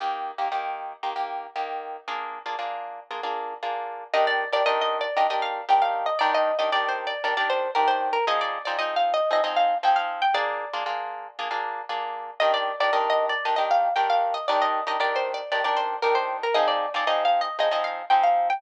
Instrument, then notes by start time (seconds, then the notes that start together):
acoustic guitar (steel)
0.00 D#3 A#3 G4
0.38 D#3 A#3 G4
0.52 D#3 A#3 G4
1.03 D#3 A#3 G4
1.16 D#3 A#3 G4
1.56 D#3 A#3 G4
2.08 A#3 D4 F4 G#4
2.46 A#3 D4 F4 G#4
2.59 A#3 D4 F4 G#4
3.11 A#3 D4 F4 G#4
3.23 A#3 D4 F4 G#4
3.63 A#3 D4 F4 G#4
4.14 D#3 D4 G4 A#4 D#5
4.27 D5
4.53 D#3 D4 G4 A#4 D5
4.66 D#3 D4 G4 A#4 D#5
4.81 D#5
5.01 D5
5.17 D#3 D4 G4 A#4 D#5
5.30 D#3 D4 G4 A#4 D#5
5.42 F5
5.69 D#3 D4 G4 A#4 G5
5.82 F5
6.06 D#5
6.19 D#3 D4 G4 A#4 D5
6.34 D#5
6.59 D#3 D4 G4 A#4 D#5
6.72 D#3 D4 G4 A#4 D5
6.89 C5
7.07 D5
7.24 D#3 D4 G4 A#4 D5
7.37 D#3 D4 G4 A#4 D5
7.50 C5
7.75 D#3 D4 G4 A#4
7.88 C5
8.13 A#4
8.27 F3 C4 D#4 G#4 D#5
8.41 D5
8.65 F3 C4 D#4 G#4 D5
8.79 F3 C4 D#4 G#4 D#5
8.96 F5
9.14 D#5
9.31 F3 C4 D#4 G#4 D#5
9.44 F3 C4 D#4 G#4 D#5
9.56 F5
9.83 F3 C4 D#4 G#4 G5
9.96 F5
10.22 G5
10.34 A#3 D4 F4 G#4 D5
10.73 A#3 D4 F4 G#4
10.86 A#3 D4 F4 G#4
11.39 A#3 D4 F4 G#4
11.51 A#3 D4 F4 G#4
11.89 A#3 D4 F4 G#4
12.40 D#3 D4 G4 A#4 D#5
12.54 D5
12.80 D#3 D4 G4 A#4 D5
12.93 D#3 D4 G4 A#4 D#5
13.10 D#5
13.29 D5
13.45 D#3 D4 G4 A#4 D#5
13.56 D#3 D4 G4 A#4 D#5
13.71 F5
13.96 D#3 D4 G4 A#4 G5
14.10 F5
14.34 D#5
14.48 D#3 D4 G4 A#4 D5
14.62 D#5
14.87 D#3 D4 G4 A#4 D#5
15.00 D#3 D4 G4 A#4 D5
15.16 C5
15.34 D5
15.52 D#3 D4 G4 A#4 D5
15.64 D#3 D4 G4 A#4 D5
15.77 C5
16.02 D#3 D4 G4 A#4
16.15 C5
16.43 A#4
16.54 F3 C4 D#4 G#4 D#5
16.68 D5
16.94 F3 C4 D#4 G#4 D5
17.07 F3 C4 D#4 G#4 D#5
17.25 F5
17.41 D#5
17.59 F3 C4 D#4 G#4 D#5
17.71 F3 C4 D#4 G#4 D#5
17.84 F5
18.10 F3 C4 D#4 G#4 G5
18.23 F5
18.50 G5